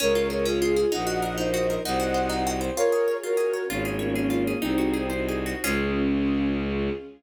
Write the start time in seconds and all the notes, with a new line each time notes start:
0.00 C#2 C#4 F4 G#4 A#4 C#5
0.15 F4
0.30 G#4 A#4 C#5
0.45 C#4 F4 G#4 C#5
0.62 F4
0.76 G#4
0.92 A#1 D#4 F#4 A#4 D#5 F#5
1.07 F#4
1.22 A#4 D#5 F#5
1.37 A#3 D#4 A#4 C5 D#5
1.54 F#4
1.70 A#4
1.85 C2 D#4 F#4 C5 D#5 F#5
2.00 F#4
2.14 C5
2.29 C4 D#4 C5
2.47 F#4
2.61 C5
2.76 F4 G#4 A#4 C#5
2.92 G#4
3.08 C#5
3.23 C#4 F4 F#4 A#4 C#5
3.37 G#4
3.53 C#5
3.69 G#1 A#3 C#4 F4 G#4 C#5
3.85 G#4
3.99 A#3 C#4 C#5
4.14 A#3 C#4 F4 G#4 C#5
4.30 F4
4.47 G#4
4.61 C2 C4 D#4 F#4 G#4 C5
4.78 F#4
4.94 G#4
5.10 D#4 F#4 C5 D#5
5.29 G#4
5.46 F#4
5.63 C#2 C#4 F4 G#4